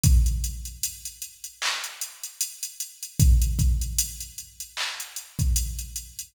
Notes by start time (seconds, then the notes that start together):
0.03 kick, closed hi-hat
0.26 closed hi-hat
0.44 closed hi-hat
0.65 closed hi-hat
0.83 closed hi-hat
1.05 closed hi-hat
1.22 closed hi-hat
1.44 closed hi-hat
1.62 clap
1.84 closed hi-hat
2.01 closed hi-hat
2.24 closed hi-hat
2.41 closed hi-hat
2.63 closed hi-hat
2.80 closed hi-hat
3.03 closed hi-hat
3.20 kick, closed hi-hat
3.42 closed hi-hat
3.59 kick, closed hi-hat
3.81 closed hi-hat
3.99 closed hi-hat
4.21 closed hi-hat
4.38 closed hi-hat
4.60 closed hi-hat
4.77 clap
5.00 closed hi-hat
5.16 closed hi-hat
5.39 kick, closed hi-hat
5.56 closed hi-hat
5.79 closed hi-hat
5.96 closed hi-hat
6.19 closed hi-hat